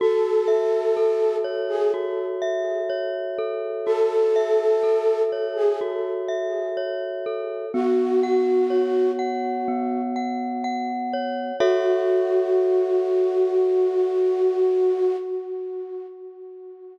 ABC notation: X:1
M:4/4
L:1/16
Q:1/4=62
K:F#dor
V:1 name="Flute"
A6 z G z8 | A6 z G z8 | F6 z10 | F16 |]
V:2 name="Glockenspiel"
F2 e2 A2 c2 F2 e2 c2 A2 | F2 e2 A2 c2 F2 e2 c2 A2 | B,2 f2 c2 f2 B,2 f2 f2 c2 | [FAce]16 |]